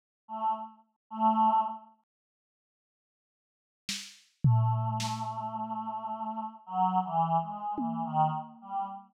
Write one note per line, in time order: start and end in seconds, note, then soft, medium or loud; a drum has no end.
0.28 0.53 A3 medium
1.10 1.60 A3 loud
3.89 snare medium
4.44 6.44 A3 medium
4.44 floor tom medium
5.00 snare medium
6.66 7.00 F#3 loud
7.04 7.37 E3 medium
7.41 7.75 G#3 medium
7.78 8.03 E3 medium
7.78 high tom medium
8.05 8.30 D#3 loud
8.61 8.86 G3 medium